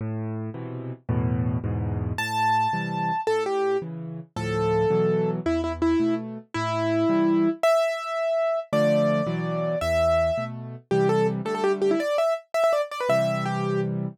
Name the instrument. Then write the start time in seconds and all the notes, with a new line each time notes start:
acoustic grand piano
0.01 A2
0.54 B2 C3 E3
1.09 E2 A2 B2
1.64 E2 G#2 B2
2.18 A2 A5
2.73 C3 E3 G3
3.27 A2 A4
3.46 G4
3.82 C#3 E3
4.36 D2 A2 F3 A4
4.90 B2 E3 F#3
5.46 E2 E4
5.64 E4
5.82 E4
6.00 B2 A3
6.54 A2 E4
7.09 C3 E3 G3
7.63 E5
8.73 D3 F3 A3 D5
9.27 B2 E3 F#3
9.81 E2 E5
10.38 B2 A3
10.91 C3 E3 G3 G4
11.09 A4
11.45 D3 G3 A3 A4
11.55 A4
11.64 G4
11.82 G4
11.91 E4
12.00 D5
12.18 E5
12.54 E5
12.64 E5
12.73 D5
12.91 D5
13.00 B4
13.09 C3 E3 G3 E5
13.45 G4